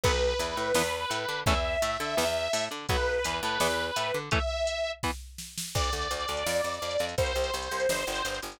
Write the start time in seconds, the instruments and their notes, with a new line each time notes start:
0.04 electric bass (finger) B1, overdriven guitar F#3 B3, lead 2 (sawtooth) B4, kick, crash
0.39 electric bass (finger) E2, overdriven guitar E3, closed hi-hat
0.56 electric bass (finger) A2, overdriven guitar A3
0.74 electric bass (finger) E2, overdriven guitar E3 B3, snare
1.10 electric bass (finger) A2, overdriven guitar A3, closed hi-hat
1.28 electric bass (finger) D3, overdriven guitar D4
1.46 electric bass (finger) E2, overdriven guitar E3 A3 C#4, lead 2 (sawtooth) E5, kick, closed hi-hat
1.82 electric bass (finger) A2, overdriven guitar A3, closed hi-hat
2.00 electric bass (finger) D3, overdriven guitar D4
2.17 electric bass (finger) E2, overdriven guitar E3 B3, snare
2.53 electric bass (finger) A2, overdriven guitar A3, open hi-hat
2.71 electric bass (finger) D3, overdriven guitar D4
2.89 electric bass (finger) B1, overdriven guitar F#3 B3, lead 2 (sawtooth) B4, kick, closed hi-hat
3.24 electric bass (finger) E2, overdriven guitar E3, closed hi-hat
3.43 electric bass (finger) A2, overdriven guitar A3
3.60 electric bass (finger) E2, overdriven guitar E3 B3, snare
3.96 electric bass (finger) A2, overdriven guitar A3, closed hi-hat
4.14 electric bass (finger) D3, overdriven guitar D4
4.31 overdriven guitar E3 A3 C#4, lead 2 (sawtooth) E5, kick, closed hi-hat
4.67 closed hi-hat
5.03 overdriven guitar E3 B3, kick, snare
5.38 snare
5.58 snare
5.75 electric bass (finger) D2, lead 2 (sawtooth) D5, kick, crash
5.84 closed hi-hat
5.92 electric bass (finger) D2, closed hi-hat
6.02 closed hi-hat
6.11 electric bass (finger) D2, closed hi-hat
6.20 closed hi-hat
6.28 electric bass (finger) D2, closed hi-hat
6.37 closed hi-hat
6.46 electric bass (finger) F2, snare
6.56 closed hi-hat
6.64 electric bass (finger) F2, closed hi-hat
6.74 closed hi-hat
6.82 electric bass (finger) F2, closed hi-hat
6.91 closed hi-hat
6.99 electric bass (finger) F2, closed hi-hat
7.09 closed hi-hat
7.18 electric bass (finger) C2, lead 2 (sawtooth) C5, kick, closed hi-hat
7.26 closed hi-hat
7.35 electric bass (finger) C2, closed hi-hat
7.44 closed hi-hat
7.54 electric bass (finger) C2, closed hi-hat
7.62 closed hi-hat
7.71 electric bass (finger) C2, closed hi-hat
7.80 closed hi-hat
7.89 electric bass (finger) G1, snare
7.98 closed hi-hat
8.07 electric bass (finger) G1, closed hi-hat
8.16 closed hi-hat
8.25 electric bass (finger) G1, closed hi-hat
8.34 closed hi-hat
8.42 electric bass (finger) G1, closed hi-hat
8.52 closed hi-hat